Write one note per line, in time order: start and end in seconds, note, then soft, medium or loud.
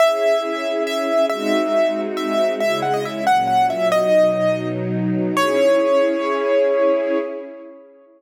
0.00 1.29 C#4 medium
0.00 1.29 E4 medium
0.00 1.29 G#4 medium
0.00 0.83 E5 medium
0.87 1.26 E5 medium
1.30 2.60 G#3 medium
1.30 2.60 C4 medium
1.30 2.60 D#4 medium
1.30 2.60 F#4 medium
1.30 2.01 E5 medium
2.17 2.55 E5 medium
2.60 3.25 C#3 medium
2.60 3.25 G#3 medium
2.60 3.25 E4 medium
2.60 2.80 E5 medium
2.82 2.93 F#5 medium
2.94 3.04 D#5 medium
3.05 3.25 E5 medium
3.26 3.91 A#2 medium
3.26 3.91 F#3 medium
3.26 3.91 C#4 medium
3.26 3.47 F#5 medium
3.47 3.67 F#5 medium
3.70 3.88 E5 medium
3.91 5.35 B2 medium
3.91 5.35 F#3 medium
3.91 5.35 D#4 medium
3.91 4.68 D#5 medium
5.37 7.18 C#4 loud
5.37 7.18 E4 loud
5.37 7.18 G#4 medium
5.37 7.18 C#5 loud